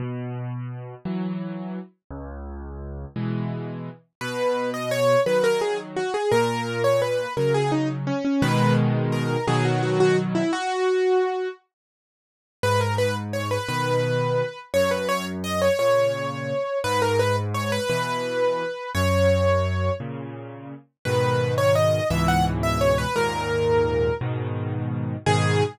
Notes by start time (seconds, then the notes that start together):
0.00 B2
1.05 E3 F#3
2.11 C#2
3.16 B2 E3 G#3
4.21 B2 B4
4.74 D#5
4.91 C#5
5.26 D#3 F#3 B4
5.44 A#4
5.61 G#4
5.96 F#4
6.14 G#4
6.32 A#2 A#4
6.84 C#5
7.02 B4
7.37 C#3 F#3 A#4
7.54 G#4
7.72 D#4
8.07 C#4
8.25 C#4
8.42 B2 D#3 G#3 B4
9.12 A#4
9.47 B2 D#3 F#3 G#4
9.65 F#4
9.83 F#4
10.00 F#4
10.35 E4
10.53 F#4
12.63 G#2 B4
12.81 A#4
12.98 B4
13.33 C#5
13.51 B4
13.68 B2 D#3 B4
14.74 F#2 C#5
14.91 B4
15.09 C#5
15.44 D#5
15.62 C#5
15.79 A#2 C#3 C#5
16.84 G#2 B4
17.02 A#4
17.19 B4
17.54 C#5
17.72 B4
17.89 B2 E3 B4
18.95 F#2 C#5
20.00 A#2 C#3
21.05 G#2 B2 D#3 B4
21.58 C#5
21.75 D#5
22.10 C#2 G#2 B2 E3 E5
22.28 F#5
22.63 E5
22.81 C#5
22.98 B4
23.16 D#2 G#2 A#2 A#4
24.21 G#2 B2 D#3
25.26 G#2 B2 D#3 G#4